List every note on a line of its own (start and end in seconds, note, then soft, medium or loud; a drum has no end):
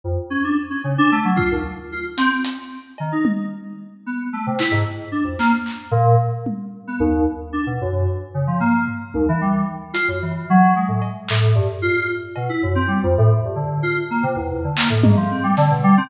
0.04 0.16 F2 medium
0.30 0.42 C#4 medium
0.44 0.56 D4 medium
0.70 0.82 C#4 medium
0.84 0.96 C#3 medium
0.98 1.10 D4 loud
1.12 1.24 A3 medium
1.25 1.37 F#3 medium
1.36 1.48 F4 medium
1.36 kick medium
1.51 1.63 D#2 medium
1.92 2.04 F4 medium
2.17 2.29 C4 loud
2.17 closed hi-hat loud
2.45 closed hi-hat loud
2.98 3.12 D#3 medium
2.98 cowbell medium
3.12 3.24 D#4 medium
3.25 high tom loud
4.06 4.18 B3 medium
4.33 4.45 A3 medium
4.47 4.59 C3 medium
4.59 4.71 E4 medium
4.59 clap medium
4.71 4.83 G#2 medium
5.12 5.24 D4 medium
5.24 5.36 F2 medium
5.39 5.51 A#3 loud
5.39 clap medium
5.66 clap medium
5.91 6.15 A#2 loud
6.46 high tom medium
6.87 6.99 B3 medium
7.00 7.24 D#2 loud
7.53 7.65 D4 medium
7.66 7.78 B2 medium
7.81 8.05 F#2 medium
8.34 8.46 C#3 medium
8.47 8.59 F3 medium
8.60 8.84 A#3 medium
8.60 floor tom medium
8.87 floor tom medium
9.14 9.26 D#2 medium
9.14 high tom medium
9.29 9.41 E3 loud
9.41 9.65 G3 medium
9.94 10.06 F4 medium
9.94 closed hi-hat loud
10.08 10.20 F#2 medium
10.22 10.46 E3 soft
10.50 10.74 F#3 loud
10.75 10.87 G#3 medium
10.88 11.00 A2 medium
11.02 cowbell medium
11.28 11.54 A2 medium
11.28 clap loud
11.55 11.67 G2 medium
11.82 12.06 F4 medium
12.36 12.48 B2 medium
12.36 cowbell medium
12.49 12.61 E4 medium
12.63 12.75 F#2 medium
12.75 12.87 C4 medium
12.87 13.00 G3 medium
13.03 13.15 F2 loud
13.18 13.30 A2 loud
13.44 13.56 G2 medium
13.56 13.80 D3 medium
13.83 13.95 F4 medium
14.11 14.23 A#3 medium
14.23 14.35 C3 medium
14.36 14.48 E2 medium
14.51 14.63 E2 medium
14.64 14.76 D3 medium
14.77 14.89 A#3 medium
14.77 clap loud
14.90 15.02 A2 medium
15.03 15.15 G#2 medium
15.03 high tom loud
15.17 15.29 F3 medium
15.31 15.43 C4 medium
15.43 15.55 G3 medium
15.57 15.69 D3 loud
15.57 snare medium
15.70 15.82 B2 medium
15.83 15.96 G3 loud
15.97 16.09 C4 loud